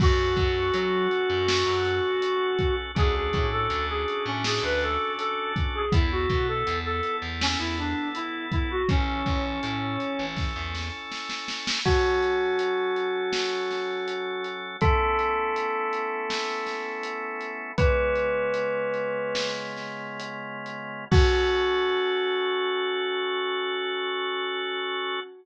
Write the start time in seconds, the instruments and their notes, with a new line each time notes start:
0.00 electric bass (finger) F#2, drawbar organ C#4 F#4 A4, lead 1 (square) F#4, kick, crash
0.37 electric bass (finger) F#2, kick, closed hi-hat
0.74 electric bass (finger) F#3, closed hi-hat
1.11 closed hi-hat
1.30 electric bass (finger) F#2
1.48 snare
1.66 electric bass (finger) F#2
1.85 closed hi-hat
2.22 closed hi-hat
2.59 kick, closed hi-hat
2.95 electric bass (finger) D2, drawbar organ C#4 D4 F#4 A4, lead 1 (square) G#4, kick, closed hi-hat
3.15 lead 1 (square) G#4
3.33 electric bass (finger) A2, kick, closed hi-hat
3.52 lead 1 (square) A4
3.70 electric bass (finger) D2, closed hi-hat
3.89 lead 1 (square) G#4
4.08 closed hi-hat
4.26 electric bass (finger) A2, lead 1 (square) C#4
4.44 lead 1 (square) G#4, snare
4.63 electric bass (finger) D2, lead 1 (square) B4
4.81 lead 1 (square) A4, closed hi-hat
5.18 lead 1 (square) A4, closed hi-hat
5.56 kick, closed hi-hat
5.75 lead 1 (square) G#4
5.92 electric bass (finger) E2, drawbar organ B3 E4 A4, lead 1 (square) E4, kick, closed hi-hat
6.11 lead 1 (square) F#4
6.29 electric bass (finger) B2, kick, closed hi-hat
6.48 lead 1 (square) A4
6.67 electric bass (finger) E2, closed hi-hat
6.85 lead 1 (square) A4
7.03 closed hi-hat
7.22 electric bass (finger) E2
7.41 lead 1 (square) C#4, snare
7.59 electric bass (finger) E2, lead 1 (square) E4
7.77 lead 1 (square) D4, closed hi-hat
8.15 lead 1 (square) E4, closed hi-hat
8.52 lead 1 (square) E4, kick, closed hi-hat
8.71 lead 1 (square) F#4
8.89 electric bass (finger) A1, lead 1 (square) C#4, drawbar organ C#4 E4 A4, kick, closed hi-hat
9.26 electric bass (finger) A1, kick, closed hi-hat
9.63 electric bass (finger) A2, closed hi-hat
10.00 closed hi-hat
10.19 electric bass (finger) A1
10.36 kick, snare
10.56 electric bass (finger) E2
10.75 snare
11.12 snare
11.29 snare
11.48 snare
11.67 snare
11.85 drawbar organ F#3 C#4 A4, tubular bells F#4, kick, crash
12.23 closed hi-hat
12.59 closed hi-hat
12.96 closed hi-hat
13.33 snare
13.71 snare, closed hi-hat
14.08 closed hi-hat
14.44 closed hi-hat
14.81 drawbar organ A3 B3 C#4 E4, tubular bells A4, kick, closed hi-hat
15.19 closed hi-hat
15.56 closed hi-hat
15.93 closed hi-hat
16.30 snare
16.67 snare, closed hi-hat
17.03 closed hi-hat
17.41 closed hi-hat
17.78 drawbar organ C#3 G#3 B3 F4, tubular bells B4, kick, closed hi-hat
18.16 closed hi-hat
18.54 closed hi-hat
18.94 closed hi-hat
19.35 snare
19.77 snare, closed hi-hat
20.20 closed hi-hat
20.66 closed hi-hat
21.11 drawbar organ C#4 F#4 A4, tubular bells F#4, kick, crash